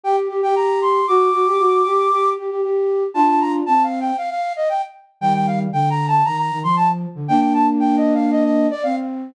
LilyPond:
<<
  \new Staff \with { instrumentName = "Flute" } { \time 4/4 \key g \minor \partial 2 \tempo 4 = 116 g''16 r8 g''16 bes''8 c'''8 | d'''2~ d'''8 r4. | a''16 a''16 bes''16 r16 \tuplet 3/2 { a''8 f''8 g''8 } f''16 f''8 ees''16 g''16 r8. | g''16 g''16 f''16 r16 \tuplet 3/2 { g''8 bes''8 a''8 } bes''16 bes''8 c'''16 a''16 r8. |
g''16 g''16 a''16 r16 \tuplet 3/2 { g''8 ees''8 f''8 } ees''16 ees''8 d''16 f''16 r8. | }
  \new Staff \with { instrumentName = "Flute" } { \time 4/4 \key g \minor \partial 2 g'8 g'16 g'16 g'4 | fis'8 fis'16 g'16 fis'8 g'8 g'8 g'16 g'16 g'4 | <d' f'>4 c'4 r2 | <ees g>4 d4 ees8 ees16 f4 d16 |
<bes d'>2. c'4 | }
>>